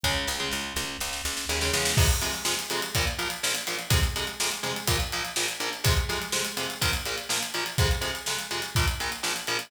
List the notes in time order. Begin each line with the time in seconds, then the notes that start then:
0.03 C#2 C#3 G#3, kick, snare
0.27 C#2, snare
0.40 C#3 G#3
0.51 C#2, snare
0.76 C#2, snare
1.00 C#2, snare
1.13 snare
1.25 C#2, snare
1.37 snare
1.49 D#2 C#3 G#3, snare
1.61 C#3 G#3, snare
1.73 E2 C#3 G#3, snare
1.85 snare
1.97 F2 C3 G#3, kick, crash
2.09 closed hi-hat
2.21 F2 C3 G#3, closed hi-hat
2.34 closed hi-hat
2.45 F2 C3 G#3, snare
2.59 closed hi-hat
2.70 F2 C3 G#3, closed hi-hat
2.82 closed hi-hat
2.95 A#1 A#2 F3, kick, closed hi-hat
3.07 closed hi-hat
3.18 A#1 A#2 F3, closed hi-hat
3.30 closed hi-hat
3.43 A#1 A#2 F3, snare
3.55 closed hi-hat
3.67 A#1 A#2 F3, closed hi-hat
3.79 closed hi-hat
3.90 F2 C3 G#3, kick, closed hi-hat
4.03 closed hi-hat
4.16 F2 C3 G#3, closed hi-hat
4.27 closed hi-hat
4.40 F2 C3 G#3, snare
4.51 closed hi-hat
4.63 F2 C3 G#3, closed hi-hat
4.76 closed hi-hat
4.87 A#1 A#2 F3, kick, closed hi-hat
5.00 closed hi-hat
5.12 A#1 A#2 F3, closed hi-hat
5.25 closed hi-hat
5.36 A#1 A#2 F3, snare
5.48 closed hi-hat
5.60 A#1 A#2 F3, closed hi-hat
5.73 closed hi-hat
5.84 F2 C3 G#3, kick, closed hi-hat
5.97 closed hi-hat
6.09 F2 C3 G#3, closed hi-hat
6.22 closed hi-hat
6.32 F2 C3 G#3, snare
6.45 closed hi-hat
6.57 F2 C3 G#3, closed hi-hat
6.70 closed hi-hat
6.81 A#1 A#2 F3, kick, closed hi-hat
6.93 closed hi-hat
7.05 A#1 A#2 F3, closed hi-hat
7.18 closed hi-hat
7.29 A#1 A#2 F3, snare
7.43 closed hi-hat
7.54 A#1 A#2 F3, closed hi-hat
7.66 closed hi-hat
7.78 F2 C3 G#3, kick, closed hi-hat
7.91 closed hi-hat
8.01 F2 C3 G#3, closed hi-hat
8.15 closed hi-hat
8.26 F2 C3 G#3, snare
8.39 closed hi-hat
8.51 F2 C3 G#3, closed hi-hat
8.62 closed hi-hat
8.75 A#1 A#2 F3, kick, closed hi-hat
8.88 closed hi-hat
9.00 A#1 A#2 F3, closed hi-hat
9.12 closed hi-hat
9.23 A#1 A#2 F3, snare
9.36 closed hi-hat
9.47 A#1 A#2 F3, closed hi-hat
9.59 closed hi-hat